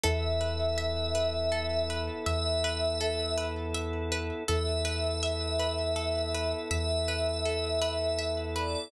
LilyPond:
<<
  \new Staff \with { instrumentName = "Pad 5 (bowed)" } { \time 6/8 \key e \mixolydian \tempo 4. = 54 e''2. | e''4. r4. | e''2. | e''2~ e''8 d''8 | }
  \new Staff \with { instrumentName = "Pizzicato Strings" } { \time 6/8 \key e \mixolydian a'8 b'8 e''8 b'8 a'8 b'8 | e''8 b'8 a'8 b'8 e''8 b'8 | a'8 b'8 e''8 b'8 a'8 b'8 | e''8 b'8 a'8 b'8 e''8 b'8 | }
  \new Staff \with { instrumentName = "Synth Bass 2" } { \clef bass \time 6/8 \key e \mixolydian e,2. | e,2. | e,2. | e,2. | }
  \new Staff \with { instrumentName = "Drawbar Organ" } { \time 6/8 \key e \mixolydian <b e' a'>2.~ | <b e' a'>2. | <b e' a'>2.~ | <b e' a'>2. | }
>>